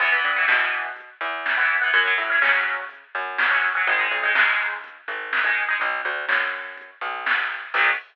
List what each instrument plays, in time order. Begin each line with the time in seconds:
0.00 electric bass (finger) E2, acoustic guitar (steel) E3 B3, kick, crash
0.12 acoustic guitar (steel) E3 B3
0.23 electric bass (finger) G2, closed hi-hat
0.36 acoustic guitar (steel) E3 B3
0.48 electric bass (finger) B2, acoustic guitar (steel) E3 B3, snare
0.73 closed hi-hat
0.96 kick, closed hi-hat
1.21 electric bass (finger) E2, closed hi-hat
1.46 snare
1.57 acoustic guitar (steel) E3 B3
1.70 kick, closed hi-hat
1.81 acoustic guitar (steel) E3 B3
1.92 electric bass (finger) F#2, acoustic guitar (steel) F#3 C#4, kick, closed hi-hat
2.06 acoustic guitar (steel) F#3 C#4
2.18 electric bass (finger) A2, closed hi-hat
2.30 acoustic guitar (steel) F#3 C#4
2.41 electric bass (finger) C#3, acoustic guitar (steel) F#3 C#4, snare
2.67 closed hi-hat
2.89 kick, closed hi-hat
3.15 electric bass (finger) F#2, closed hi-hat
3.38 snare
3.51 acoustic guitar (steel) F#3 C#4
3.63 closed hi-hat
3.75 acoustic guitar (steel) F#3 C#4
3.87 electric bass (finger) G#1, acoustic guitar (steel) G#3 D#4, kick, closed hi-hat
3.99 acoustic guitar (steel) G#3 D#4
4.10 electric bass (finger) B1, closed hi-hat
4.23 acoustic guitar (steel) G#3 D#4
4.35 electric bass (finger) D#2, acoustic guitar (steel) G#3 D#4, snare
4.60 closed hi-hat
4.84 kick, closed hi-hat
5.08 electric bass (finger) G#1, kick, closed hi-hat
5.33 snare
5.44 acoustic guitar (steel) G#3 D#4
5.57 closed hi-hat
5.69 acoustic guitar (steel) G#3 D#4
5.80 electric bass (finger) B1, kick, closed hi-hat
6.05 electric bass (finger) D2, closed hi-hat
6.29 electric bass (finger) F#2, snare
6.54 closed hi-hat
6.77 kick, closed hi-hat
7.01 electric bass (finger) B1, kick, closed hi-hat
7.26 snare
7.51 closed hi-hat
7.74 electric bass (finger) B1, acoustic guitar (steel) F#3 B3, kick, crash
7.78 acoustic guitar (steel) D#3